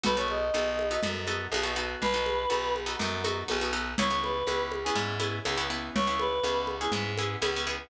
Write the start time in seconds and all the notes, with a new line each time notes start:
0.03 B1 B3 D#4 F#4 A4 B4, low conga
0.17 B3 D#4 F#4 A4 C#5
0.28 D#5, high conga
0.54 B1 B3 D#4 F#4 A4, high conga
0.79 high conga
0.91 B3 D#4 F#4 A4
1.03 F#2 B3 D#4 F#4 A4, low conga
1.27 B3 D#4 F#4 A4, high conga
1.52 B1 B3 D#4 F#4 A4, high conga
1.63 B3 D#4 F#4 A4
1.76 B3 D#4 F#4 A4
2.02 B1 B4, low conga
2.14 B3 D#4 F#4 A4
2.26 high conga
2.50 B1 B3 D#4 F#4 A4, high conga
2.76 high conga
2.86 B3 D#4 F#4 A4
2.99 F#2 B3 D#4 F#4 A4, low conga
3.24 B3 D#4 F#4 A4, high conga
3.48 B1 B3 D#4 F#4 A4, high conga
3.61 B3 D#4 F#4 A4
3.73 B3 D#4 F#4 A4
3.98 C#2 B3 C#4 E4 G#4 C#5, low conga
4.10 B3 C#4 E4 G#4
4.23 B4, high conga
4.47 C#2 B3 C#4 E4 G#4, high conga
4.72 high conga
4.84 B3 C#4 E4 G#4
4.95 G#2 B3 C#4 E4 G#4, low conga
5.20 B3 C#4 E4 G#4, high conga
5.45 C#2 B3 C#4 E4 G#4, high conga
5.57 B3 C#4 E4 G#4
5.70 B3 C#4 E4 G#4
5.95 C#2 C#5, low conga
6.07 B3 C#4 E4 G#4
6.19 B4, high conga
6.43 C#2 B3 C#4 E4 G#4, high conga
6.67 high conga
6.81 B3 C#4 E4 G#4
6.92 G#2 B3 C#4 E4 G#4, low conga
7.18 B3 C#4 E4 G#4, high conga
7.42 C#2 B3 C#4 E4 G#4, high conga
7.56 B3 C#4 E4 G#4
7.67 B3 C#4 E4 G#4